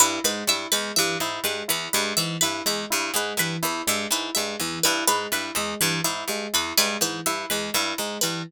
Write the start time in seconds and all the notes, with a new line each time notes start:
0.00 G2 E4 B4
0.24 G#2 G#3 B4
0.47 G2 E4 E5
0.72 E2 G#3 B4
0.96 G2 E3 E5
1.20 G#2 E4
1.44 G2 G#3 B4
1.68 E2 E4 B4
1.93 G2 G#3 B4
2.17 G#2 E3 E5
2.41 G2 E4 B4
2.66 E2 G#3 E5
2.90 G2 E4
3.14 G#2 G#3 B4
3.37 G2 E3 B4
3.63 E2 E4 B4
3.87 G2 G#3 E5
4.11 G#2 E4 B4
4.35 G2 G#3 E5
4.60 E2 E3
4.83 G2 E4 B4
5.07 G#2 G#3 B4
5.32 G2 E4 B4
5.55 E2 G#3 E5
5.81 G2 E3 B4
6.04 G#2 E4 E5
6.28 G2 G#3
6.53 E2 E4 B4
6.78 G2 G#3 B4
7.01 G#2 E3 B4
7.26 G2 E4 E5
7.50 E2 G#3 B4
7.74 G2 E4 E5
7.98 G#2 G#3
8.21 G2 E3 B4